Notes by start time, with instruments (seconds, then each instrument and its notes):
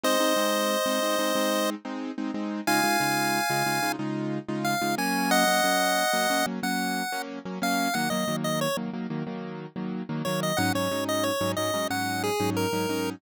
0.03 acoustic grand piano G#3 C4 D#4, lead 1 (square) C5 D#5
0.20 acoustic grand piano G#3 C4 D#4
0.36 acoustic grand piano G#3 C4 D#4
0.86 acoustic grand piano G#3 C4 D#4
1.02 acoustic grand piano G#3 C4 D#4
1.19 acoustic grand piano G#3 C4 D#4
1.35 acoustic grand piano G#3 C4 D#4
1.85 acoustic grand piano G#3 C4 D#4
2.18 acoustic grand piano G#3 C4 D#4
2.34 acoustic grand piano G#3 C4 D#4
2.67 acoustic grand piano C#3 G#3 D#4 F4, lead 1 (square) F5 G#5
2.84 acoustic grand piano C#3 G#3 D#4 F4
3.00 acoustic grand piano C#3 G#3 D#4 F4
3.50 acoustic grand piano C#3 G#3 D#4 F4
3.66 acoustic grand piano C#3 G#3 D#4 F4
3.83 acoustic grand piano C#3 G#3 D#4 F4
3.99 acoustic grand piano C#3 G#3 D#4 F4
4.48 acoustic grand piano C#3 G#3 D#4 F4
4.64 lead 1 (square) F5
4.81 acoustic grand piano C#3 G#3 D#4 F4
4.98 acoustic grand piano F#3 A#3 C#4, lead 1 (square) G#5
5.31 lead 1 (square) D#5 F#5
5.47 acoustic grand piano F#3 A#3 C#4
5.64 acoustic grand piano F#3 A#3 C#4
6.13 acoustic grand piano F#3 A#3 C#4
6.30 acoustic grand piano F#3 A#3 C#4
6.46 acoustic grand piano F#3 A#3 C#4
6.63 acoustic grand piano F#3 A#3 C#4, lead 1 (square) F#5
7.12 acoustic grand piano F#3 A#3 C#4
7.45 acoustic grand piano F#3 A#3 C#4
7.62 acoustic grand piano F#3 A#3 C#4, lead 1 (square) F5
7.94 acoustic grand piano D#3 F#3 A#3, lead 1 (square) F#5
8.10 acoustic grand piano D#3 F#3 A#3, lead 1 (square) D#5
8.28 acoustic grand piano D#3 F#3 A#3
8.44 lead 1 (square) D#5
8.61 lead 1 (square) C#5
8.77 acoustic grand piano D#3 F#3 A#3
8.93 acoustic grand piano D#3 F#3 A#3
9.10 acoustic grand piano D#3 F#3 A#3
9.27 acoustic grand piano D#3 F#3 A#3
9.76 acoustic grand piano D#3 F#3 A#3
10.09 acoustic grand piano D#3 F#3 A#3
10.25 acoustic grand piano D#3 F#3 A#3, lead 1 (square) C#5
10.43 lead 1 (square) D#5
10.57 acoustic grand piano G#2 F#3 C#4 D#4, lead 1 (square) F#5
10.75 acoustic grand piano G#2 F#3 C#4 D#4, lead 1 (square) C#5
10.91 acoustic grand piano G#2 F#3 C#4 D#4
11.09 lead 1 (square) D#5
11.23 lead 1 (square) C#5
11.41 acoustic grand piano G#2 F#3 C#4 D#4
11.56 acoustic grand piano G#2 F#3 C#4 D#4, lead 1 (square) D#5
11.74 acoustic grand piano G#2 F#3 C#4 D#4
11.90 acoustic grand piano G#2 F#3 C#4 D#4, lead 1 (square) F#5
12.23 lead 1 (square) G#4
12.40 acoustic grand piano G#2 F#3 C#4 D#4
12.56 lead 1 (square) A#4
12.73 acoustic grand piano G#2 F#3 C#4 D#4
12.89 acoustic grand piano G#2 F#3 C#4 D#4